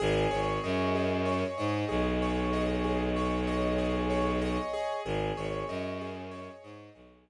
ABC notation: X:1
M:4/4
L:1/8
Q:1/4=95
K:Ab
V:1 name="Acoustic Grand Piano"
A d e A d e A d | e A d e A d e A | A d e A d e A d |]
V:2 name="Violin" clef=bass
A,,, A,,, _G,,3 A,, =B,,,2- | =B,,,8 | A,,, A,,, _G,,3 A,, =B,,,2 |]